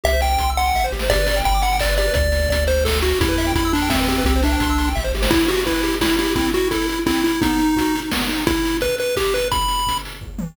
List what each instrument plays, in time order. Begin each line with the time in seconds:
0.04 synth bass 1 C2, lead 1 (square) G4 E5, kick, closed hi-hat
0.13 lead 1 (square) C5
0.20 lead 1 (square) E5 G5, open hi-hat
0.31 lead 1 (square) G5
0.38 synth bass 1 C2, lead 1 (square) C6, kick, closed hi-hat
0.50 lead 1 (square) E6
0.57 lead 1 (square) F#5 C6, open hi-hat
0.66 lead 1 (square) G5
0.74 synth bass 1 A1, lead 1 (square) E5, kick, snare
0.84 lead 1 (square) C5
0.92 synth bass 1 G#1, lead 1 (square) G4, snare
0.99 lead 1 (square) C5, snare
1.10 synth bass 1 G1, lead 1 (square) G4 D5, kick, closed hi-hat
1.19 lead 1 (square) B4
1.27 lead 1 (square) D5, open hi-hat
1.36 lead 1 (square) G5
1.44 synth bass 1 G1, lead 1 (square) G5 B5, kick, closed hi-hat
1.54 lead 1 (square) D6
1.62 lead 1 (square) F#5 B5, open hi-hat
1.73 lead 1 (square) G5
1.80 lead 1 (square) D5, kick, clap
1.89 lead 1 (square) B4
1.97 lead 1 (square) G4 D5, open hi-hat
2.07 lead 1 (square) B4
2.14 synth bass 1 D2, lead 1 (square) D5, kick, closed hi-hat
2.32 open hi-hat
2.49 synth bass 1 D2, lead 1 (square) D5, kick, closed hi-hat
2.67 lead 1 (square) C5, open hi-hat
2.85 lead 1 (square) A4, kick, snare
3.01 lead 1 (square) F#4, open hi-hat
3.21 synth bass 1 E2, lead 1 (square) E4 G4, kick, closed hi-hat
3.28 lead 1 (square) B4
3.37 lead 1 (square) E5, open hi-hat
3.47 lead 1 (square) G5
3.55 synth bass 1 E2, lead 1 (square) E4 B5, kick, closed hi-hat
3.65 lead 1 (square) E6
3.73 lead 1 (square) D4 B5, open hi-hat
3.82 lead 1 (square) G5
3.90 lead 1 (square) C4 E5, kick, snare
4.00 lead 1 (square) B4
4.08 lead 1 (square) C4 G4, open hi-hat
4.18 lead 1 (square) B4
4.24 synth bass 1 C2, lead 1 (square) C4 G4, kick, closed hi-hat
4.36 lead 1 (square) C5
4.43 lead 1 (square) D4 E5, open hi-hat
4.52 lead 1 (square) G5
4.60 synth bass 1 C2, lead 1 (square) C6, kick, closed hi-hat
4.70 lead 1 (square) E6
4.78 lead 1 (square) C6, open hi-hat
4.88 lead 1 (square) G5
4.95 synth bass 1 A1, lead 1 (square) E5, kick, snare
5.04 lead 1 (square) C5
5.13 synth bass 1 G#1, lead 1 (square) G4, snare
5.22 lead 1 (square) C5, snare
5.31 lead 1 (square) E4, kick, crash
5.39 closed hi-hat
5.48 lead 1 (square) F#4 G4, open hi-hat
5.57 closed hi-hat
5.65 lead 1 (square) E4 B4, kick, closed hi-hat
5.74 closed hi-hat
5.83 lead 1 (square) G4, open hi-hat
5.92 closed hi-hat
6.01 lead 1 (square) E4, kick, snare
6.10 closed hi-hat
6.18 lead 1 (square) E4 G4, open hi-hat
6.27 closed hi-hat
6.35 lead 1 (square) C4 E4, kick, closed hi-hat
6.45 closed hi-hat
6.53 lead 1 (square) E4 F#4, open hi-hat
6.62 closed hi-hat
6.71 lead 1 (square) E4 A4, kick, closed hi-hat
6.82 closed hi-hat
6.88 lead 1 (square) E4, open hi-hat
6.97 closed hi-hat
7.06 lead 1 (square) C4 E4, kick, clap
7.16 closed hi-hat
7.24 lead 1 (square) E4, open hi-hat
7.33 closed hi-hat
7.41 lead 1 (square) B3 D#4, kick, closed hi-hat
7.49 closed hi-hat
7.58 lead 1 (square) D#4, open hi-hat
7.66 closed hi-hat
7.76 lead 1 (square) F#4, kick, closed hi-hat
7.85 closed hi-hat
7.95 lead 1 (square) D#4, open hi-hat
8.04 closed hi-hat
8.11 lead 1 (square) B3, kick, snare
8.20 closed hi-hat
8.29 lead 1 (square) D#4, open hi-hat
8.38 closed hi-hat
8.47 lead 1 (square) E4, kick, closed hi-hat
8.56 closed hi-hat
8.65 open hi-hat
8.74 closed hi-hat
8.81 lead 1 (square) B4, kick, closed hi-hat
8.89 closed hi-hat
8.98 lead 1 (square) B4, open hi-hat
9.09 closed hi-hat
9.16 lead 1 (square) G4, kick, clap
9.24 closed hi-hat
9.34 lead 1 (square) B4, open hi-hat
9.44 closed hi-hat
9.51 lead 1 (square) B5, kick, closed hi-hat
9.61 closed hi-hat
9.68 open hi-hat
9.79 closed hi-hat
9.87 kick, closed hi-hat
9.97 closed hi-hat
10.05 open hi-hat
10.14 closed hi-hat
10.21 kick, floor tom
10.39 high tom